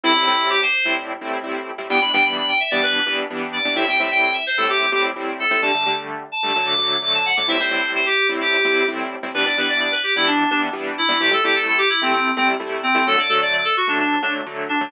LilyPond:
<<
  \new Staff \with { instrumentName = "Electric Piano 2" } { \time 4/4 \key e \minor \tempo 4 = 129 e'4 g'16 c''8. r2 | g''16 b''16 g''16 b''16 b''16 g''16 e''16 d''16 b'8 b'16 r8. d''8 | e''16 g''16 e''16 g''16 g''16 e''16 c''16 a'16 g'8 g'16 r8. a'8 | a''8. r8. a''8 a''16 d'''8. d'''16 a''16 fis''16 d'''16 |
e''16 c''8. c''16 g'8 r16 g'4 r4 | b'16 d''16 b'16 d''16 d''16 b'16 g'16 e'16 d'8 d'16 r8. e'8 | g'16 a'16 g'16 a'16 a'16 g'16 e'16 c'16 c'8 c'16 r8. c'8 | a'16 d''16 a'16 d''16 d''16 a'16 fis'16 d'16 d'8 d'16 r8. d'8 | }
  \new Staff \with { instrumentName = "Lead 2 (sawtooth)" } { \time 4/4 \key e \minor <a, g c' e'>16 <a, g c' e'>16 <a, g c' e'>4~ <a, g c' e'>16 <a, g c' e'>8. <a, g c' e'>8 <a, g c' e'>8. <a, g c' e'>16 | <e g b d'>16 <e g b d'>16 <e g b d'>4~ <e g b d'>16 <e g b d'>8. <e g b d'>8 <e g b d'>8. <e g b d'>16 | <a, g c' e'>16 <a, g c' e'>16 <a, g c' e'>4~ <a, g c' e'>16 <a, g c' e'>8. <a, g c' e'>8 <a, g c' e'>8. <a, g c' e'>16 | <d g a>16 <d g a>16 <d g a>4~ <d g a>16 <d g a>16 <d fis a>8 <d fis a>8 <d fis a>8. <d fis a>16 |
<a, g c' e'>16 <a, g c' e'>16 <a, g c' e'>4~ <a, g c' e'>16 <a, g c' e'>8. <a, g c' e'>8 <a, g c' e'>8. <a, g c' e'>16 | <e g b d'>16 <e g b d'>16 <e g b d'>4~ <e g b d'>16 <e g b d'>8. <e g b d'>8 <e g b d'>8. <e g b d'>16 | <c g a e'>16 <c g a e'>16 <c g a e'>4~ <c g a e'>16 <c g a e'>8. <c g a e'>8 <c g a e'>8. <c g a e'>16 | <d fis a>16 <d fis a>16 <d fis a>4~ <d fis a>16 <d fis a>8. <d fis a>8 <d fis a>8. <d fis a>16 | }
>>